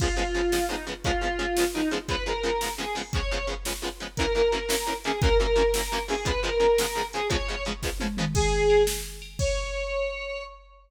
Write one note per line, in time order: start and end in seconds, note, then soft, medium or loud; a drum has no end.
0.00 0.08 C#3 medium
0.00 0.08 F3 medium
0.00 0.08 G#3 medium
0.00 0.08 B3 medium
0.00 0.15 F4 loud
0.00 kick loud
0.00 crash loud
0.17 0.23 C#3 medium
0.17 0.23 F3 medium
0.17 0.23 G#3 medium
0.17 0.23 B3 medium
0.17 0.65 F4 medium
0.34 0.41 C#3 medium
0.34 0.41 F3 medium
0.34 0.41 G#3 medium
0.34 0.41 B3 medium
0.34 closed hi-hat medium
0.52 0.59 C#3 medium
0.52 0.59 F3 medium
0.52 0.59 G#3 medium
0.52 0.59 B3 medium
0.52 snare loud
0.69 0.76 C#3 medium
0.69 0.76 F3 medium
0.69 0.76 G#3 medium
0.69 0.76 B3 medium
0.69 0.85 D#4 medium
0.87 0.94 C#3 medium
0.87 0.94 F3 medium
0.87 0.94 G#3 medium
0.87 0.94 B3 medium
0.87 closed hi-hat medium
1.04 1.12 C#3 medium
1.04 1.12 F3 medium
1.04 1.12 G#3 medium
1.04 1.12 B3 medium
1.04 1.21 F4 loud
1.04 kick loud
1.04 closed hi-hat medium
1.21 1.28 C#3 medium
1.21 1.28 F3 medium
1.21 1.28 G#3 medium
1.21 1.28 B3 medium
1.21 1.63 F4 medium
1.39 1.46 C#3 medium
1.39 1.46 F3 medium
1.39 1.46 G#3 medium
1.39 1.46 B3 medium
1.39 closed hi-hat medium
1.57 1.65 C#3 medium
1.57 1.65 F3 medium
1.57 1.65 G#3 medium
1.57 1.65 B3 medium
1.57 snare loud
1.74 1.82 C#3 medium
1.74 1.82 F3 medium
1.74 1.82 G#3 medium
1.74 1.82 B3 medium
1.74 1.88 D#4 loud
1.91 1.98 C#3 medium
1.91 1.98 F3 medium
1.91 1.98 G#3 medium
1.91 1.98 B3 medium
1.91 closed hi-hat medium
2.08 2.16 C#3 medium
2.08 2.16 F3 medium
2.08 2.16 G#3 medium
2.08 2.16 B3 medium
2.08 2.24 B4 loud
2.08 kick medium
2.08 closed hi-hat medium
2.26 2.33 C#3 medium
2.26 2.33 F3 medium
2.26 2.33 G#3 medium
2.26 2.33 B3 medium
2.26 2.70 A#4 medium
2.43 2.50 C#3 medium
2.43 2.50 F3 medium
2.43 2.50 G#3 medium
2.43 2.50 B3 medium
2.43 closed hi-hat medium
2.61 2.69 C#3 medium
2.61 2.69 F3 medium
2.61 2.69 G#3 medium
2.61 2.69 B3 medium
2.61 snare loud
2.78 2.85 C#3 medium
2.78 2.85 F3 medium
2.78 2.85 G#3 medium
2.78 2.85 B3 medium
2.78 2.96 G#4 medium
2.95 3.02 C#3 medium
2.95 3.02 F3 medium
2.95 3.02 G#3 medium
2.95 3.02 B3 medium
2.95 open hi-hat medium
3.13 3.21 C#3 medium
3.13 3.21 F3 medium
3.13 3.21 G#3 medium
3.13 3.21 B3 medium
3.13 3.46 C#5 loud
3.13 kick loud
3.13 closed hi-hat medium
3.31 3.38 C#3 medium
3.31 3.38 F3 medium
3.31 3.38 G#3 medium
3.31 3.38 B3 medium
3.47 3.54 C#3 medium
3.47 3.54 F3 medium
3.47 3.54 G#3 medium
3.47 3.54 B3 medium
3.47 closed hi-hat medium
3.65 3.73 C#3 medium
3.65 3.73 F3 medium
3.65 3.73 G#3 medium
3.65 3.73 B3 medium
3.65 snare loud
3.82 3.89 C#3 medium
3.82 3.89 F3 medium
3.82 3.89 G#3 medium
3.82 3.89 B3 medium
4.00 4.07 C#3 medium
4.00 4.07 F3 medium
4.00 4.07 G#3 medium
4.00 4.07 B3 medium
4.00 closed hi-hat medium
4.17 4.26 F#2 medium
4.17 4.26 E3 medium
4.17 4.26 A#3 medium
4.17 4.33 A#4 loud
4.17 kick loud
4.17 closed hi-hat loud
4.21 4.26 C#4 medium
4.35 4.42 F#2 medium
4.35 4.42 E3 medium
4.35 4.42 A#3 medium
4.35 4.42 C#4 medium
4.35 4.94 A#4 medium
4.52 4.59 F#2 medium
4.52 4.59 E3 medium
4.52 4.59 A#3 medium
4.52 4.59 C#4 medium
4.52 closed hi-hat medium
4.69 4.76 F#2 medium
4.69 4.76 E3 medium
4.69 4.76 A#3 medium
4.69 4.76 C#4 medium
4.69 snare loud
4.87 4.94 F#2 medium
4.87 4.94 E3 medium
4.87 4.94 A#3 medium
4.87 4.94 C#4 medium
5.04 5.12 F#2 medium
5.04 5.12 E3 medium
5.04 5.12 A#3 medium
5.04 5.12 C#4 medium
5.04 5.20 G#4 medium
5.04 closed hi-hat medium
5.22 5.29 F#2 medium
5.22 5.29 E3 medium
5.22 5.29 A#3 medium
5.22 5.29 C#4 medium
5.22 5.37 A#4 loud
5.22 kick loud
5.22 closed hi-hat loud
5.39 5.47 F#2 medium
5.39 5.47 E3 medium
5.39 5.47 A#3 medium
5.39 5.47 C#4 medium
5.39 6.03 A#4 medium
5.56 5.63 F#2 medium
5.56 5.63 E3 medium
5.56 5.63 A#3 medium
5.56 5.63 C#4 medium
5.56 closed hi-hat medium
5.74 5.82 F#2 medium
5.74 5.82 E3 medium
5.74 5.82 A#3 medium
5.74 5.82 C#4 medium
5.74 snare loud
5.92 5.99 F#2 medium
5.92 5.99 E3 medium
5.92 5.99 A#3 medium
5.92 5.99 C#4 medium
6.08 6.15 F#2 medium
6.08 6.15 E3 medium
6.08 6.15 A#3 medium
6.08 6.15 C#4 medium
6.08 6.26 G#4 loud
6.08 open hi-hat medium
6.25 6.32 C#3 medium
6.25 6.32 F3 medium
6.25 6.32 G#3 medium
6.25 6.32 B3 medium
6.25 6.40 B4 loud
6.25 kick loud
6.25 closed hi-hat loud
6.43 6.50 C#3 medium
6.43 6.50 F3 medium
6.43 6.50 G#3 medium
6.43 6.50 B3 medium
6.43 7.06 A#4 medium
6.60 6.67 C#3 medium
6.60 6.67 F3 medium
6.60 6.67 G#3 medium
6.60 6.67 B3 medium
6.60 closed hi-hat medium
6.78 6.86 C#3 medium
6.78 6.86 F3 medium
6.78 6.86 G#3 medium
6.78 6.86 B3 medium
6.78 snare loud
6.95 7.02 C#3 medium
6.95 7.02 F3 medium
6.95 7.02 G#3 medium
6.95 7.02 B3 medium
7.13 7.21 C#3 medium
7.13 7.21 F3 medium
7.13 7.21 G#3 medium
7.13 7.21 B3 medium
7.13 7.28 G#4 loud
7.13 closed hi-hat medium
7.30 7.37 C#3 medium
7.30 7.37 F3 medium
7.30 7.37 G#3 medium
7.30 7.37 B3 medium
7.30 7.64 C#5 loud
7.30 kick loud
7.30 closed hi-hat loud
7.48 7.55 C#3 medium
7.48 7.55 F3 medium
7.48 7.55 G#3 medium
7.48 7.55 B3 medium
7.65 7.73 C#3 medium
7.65 7.73 F3 medium
7.65 7.73 G#3 medium
7.65 7.73 B3 medium
7.65 closed hi-hat medium
7.83 7.90 C#3 medium
7.83 7.90 F3 medium
7.83 7.90 G#3 medium
7.83 7.90 B3 medium
7.83 kick medium
7.83 snare medium
8.00 8.07 C#3 medium
8.00 8.07 F3 medium
8.00 8.07 G#3 medium
8.00 8.07 B3 medium
8.00 high tom medium
8.17 8.25 C#3 medium
8.17 8.25 F3 medium
8.17 8.25 G#3 medium
8.17 8.25 B3 medium
8.17 mid tom loud
8.35 8.83 G#4 loud
8.35 kick loud
8.35 crash loud
8.70 ride medium
8.87 snare loud
9.22 ride medium
9.39 10.43 C#5 loud
9.39 kick loud
9.39 crash loud